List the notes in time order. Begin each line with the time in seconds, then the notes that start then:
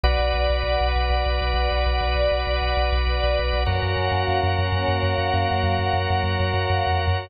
0.04 B1 F#4 B4 D5 F#5
0.19 B1
0.34 B1
0.50 B1
0.63 B1
0.81 B1
0.96 B1
1.10 B1
1.26 B1
1.41 B1
1.54 B1
1.71 B1
1.86 B1
2.01 B1
2.15 B1
2.32 B1
2.47 B1
2.61 B1
2.77 B1
2.92 B1
3.07 B1
3.24 B1
3.39 B1
3.53 B1
3.66 F#2 A#3 C#4 F#4 A#4 C#5
3.83 F#2
3.97 F#2
4.12 F#2
4.28 F#2
4.43 F#2
4.59 F#2
4.72 F#2
4.88 F#2
5.03 F#2
5.18 F#2
5.34 F#2
5.49 F#2 F#3 A#3 F#4
5.64 F#2
5.79 F#2
5.93 F#2
6.10 F#2
6.24 F#2
6.40 F#2
6.54 F#2
6.70 F#2
6.87 F2
7.07 F#2